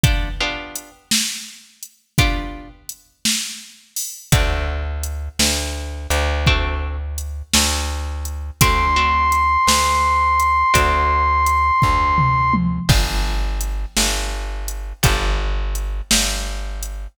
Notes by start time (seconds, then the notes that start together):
0.03 B3 D4 F4 G4, kick, closed hi-hat
0.40 B3 D4 F4 G4
0.75 closed hi-hat
1.11 snare
1.83 closed hi-hat
2.18 B3 D4 F4 G4, kick, closed hi-hat
2.89 closed hi-hat
3.25 snare
3.96 open hi-hat
4.32 D2 A3 C4 D4 F#4, kick, closed hi-hat
5.03 closed hi-hat
5.39 D2, snare
6.10 D2, closed hi-hat
6.46 A3 C4 D4 F#4, kick
7.18 closed hi-hat
7.53 D2, snare
8.25 closed hi-hat
8.61 D2 A3 C4 D4 F#4 C6, kick, closed hi-hat
8.96 A3 C4 D4 F#4
9.32 closed hi-hat
9.67 D2, snare
10.40 closed hi-hat
10.74 D2 A3 C4 D4 F#4, kick, closed hi-hat
11.46 closed hi-hat
11.82 D2, kick, floor tom
12.18 mid tom
12.53 high tom
12.89 G1 B3 D4 F4 G4, kick, crash
13.61 closed hi-hat
13.97 G1, snare
14.68 closed hi-hat
15.03 G1 B3 D4 F4 G4, kick, closed hi-hat
15.75 closed hi-hat
16.11 G1, snare
16.83 closed hi-hat